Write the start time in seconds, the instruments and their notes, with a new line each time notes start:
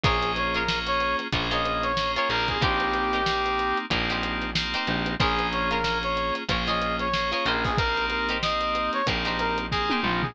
0.03 electric bass (finger) A#1, electric piano 2 A#3 C#4 F4 G#4, pizzicato strings F4 G#4 A#4 C#5, brass section G#4, kick, closed hi-hat
0.22 closed hi-hat
0.36 brass section C#5, snare, closed hi-hat
0.54 pizzicato strings F4 G#4 A#4 C#5, brass section A#4, closed hi-hat
0.68 electric piano 2 A#3 C#4 F4 G#4, snare
0.87 brass section C#5, closed hi-hat
1.00 closed hi-hat
1.19 snare, closed hi-hat
1.33 electric bass (finger) A#1, electric piano 2 A#3 C#4 F4 G#4, pizzicato strings F4 G#4 A#4 C#5, kick, closed hi-hat
1.51 pizzicato strings F4 G#4 A#4 C#5, brass section D#5, snare, closed hi-hat
1.65 snare, closed hi-hat
1.83 brass section C#5, closed hi-hat
1.97 electric piano 2 A#3 C#4 F4 G#4, snare
2.15 pizzicato strings F4 G#4 A#4 C#5, brass section C#5, snare, closed hi-hat
2.29 electric bass (finger) A#1, electric piano 2 A#3 C4 D#4 G4, brass section A#4, closed hi-hat
2.48 brass section G#4, kick, closed hi-hat
2.61 electric bass (finger) A#1, pizzicato strings D#4 G4 A#4 C5, brass section G4, kick, closed hi-hat
2.80 closed hi-hat
2.93 snare, closed hi-hat
3.13 pizzicato strings D#4 G4 A#4 C5, closed hi-hat
3.26 electric piano 2 A#3 C4 D#4 G4, snare
3.46 closed hi-hat
3.59 closed hi-hat
3.77 closed hi-hat
3.90 electric bass (finger) A#1, electric piano 2 A#3 C4 D#4 G4, pizzicato strings D#4 G4 A#4 C5, kick, closed hi-hat
4.10 pizzicato strings D#4 G4 A#4 C5, snare, closed hi-hat
4.23 closed hi-hat
4.42 snare, closed hi-hat
4.55 electric piano 2 A#3 C4 D#4 G4, snare
4.74 pizzicato strings D#4 G4 A#4 C5, snare, closed hi-hat
4.87 electric bass (finger) A#1, closed hi-hat
5.06 closed hi-hat
5.20 electric bass (finger) A#1, electric piano 2 A#3 C#4 F4 G#4, pizzicato strings F4 G#4 A#4 C#5, brass section G#4, kick, closed hi-hat
5.39 closed hi-hat
5.52 brass section C#5, closed hi-hat
5.71 pizzicato strings F4 G#4 A#4 C#5, brass section A#4, closed hi-hat
5.84 electric piano 2 A#3 C#4 F4 G#4, snare
6.03 brass section C#5, closed hi-hat
6.17 closed hi-hat
6.35 snare, closed hi-hat
6.49 electric bass (finger) A#1, electric piano 2 A#3 C#4 F4 G#4, pizzicato strings F4 G#4 A#4 C#5, kick, closed hi-hat
6.67 pizzicato strings F4 G#4 A#4 C#5, brass section D#5, snare, closed hi-hat
6.82 closed hi-hat
6.99 brass section C#5, closed hi-hat
7.13 electric piano 2 A#3 C#4 F4 G#4, snare
7.32 pizzicato strings F4 G#4 A#4 C#5, brass section C#5, closed hi-hat
7.46 electric bass (finger) A#1, pizzicato strings D#4 G4 A#4 C5, brass section A#4, closed hi-hat
7.64 brass section G#4, kick, open hi-hat
7.78 electric piano 2 A#3 C4 D#4 G4, brass section A#4, kick, closed hi-hat
7.97 snare, closed hi-hat
8.10 brass section A#4, closed hi-hat
8.29 pizzicato strings D#4 G4 A#4 C5, closed hi-hat
8.42 electric piano 2 A#3 C4 D#4 G4, brass section D#5, snare
8.61 closed hi-hat
8.75 closed hi-hat
8.93 brass section C#5, snare, closed hi-hat
9.07 electric bass (finger) A#1, electric piano 2 A#3 C4 D#4 G4, pizzicato strings D#4 G4 A#4 C5, kick, closed hi-hat
9.25 pizzicato strings D#4 G4 A#4 C5, snare, closed hi-hat
9.39 brass section A#4, closed hi-hat
9.58 closed hi-hat
9.71 electric piano 2 A#3 C4 D#4 G4, brass section G#4, kick, snare
9.90 pizzicato strings D#4 G4 A#4 C5, high tom
10.03 electric bass (finger) A#1, brass section F4, mid tom
10.22 brass section G#4, floor tom